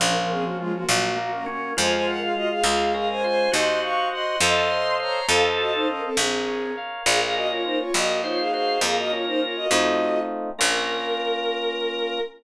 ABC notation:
X:1
M:6/8
L:1/16
Q:3/8=68
K:Bbm
V:1 name="Violin"
[DB] [DB] [CA] [B,G] [A,F] [B,G] [B,G]2 [B,G] [DB] [DB]2 | [ca] [ca] [Bg] [Af] [Ge] [Af] [Af]2 [Af] [ca] [ca]2 | [ec']2 [fd']2 [ec']2 [ec']4 [db]2 | [=Af] z [Ge] [Ec] [DB] [CA] [C_A]4 z2 |
[Af] [Af] [Ge] [Fd] [Ec] [Fd] [Ge]2 [Fd] [Af] [Af]2 | [Af] [Ge] [Fd] [Ec] [Fd] [Ge]5 z2 | B12 |]
V:2 name="Drawbar Organ"
F,6 G,2 B,2 D2 | F6 F2 B2 c2 | G6 =A2 c2 c2 | =A4 z8 |
B6 B2 c2 c2 | B6 z6 | B12 |]
V:3 name="Electric Piano 2"
B,2 D2 F2 B,2 G2 B,2 | A,2 F2 A,2 A,2 D2 F2 | c2 e2 g2 [=Acef]6 | [=Acef]6 B2 d2 f2 |
B,2 D2 F2 B,2 E2 G2 | B,2 D2 F2 [=A,CEF]6 | [B,DF]12 |]
V:4 name="Harpsichord" clef=bass
B,,,6 B,,,6 | F,,6 D,,6 | E,,6 F,,6 | F,,6 B,,,6 |
B,,,6 B,,,6 | F,,6 F,,6 | B,,,12 |]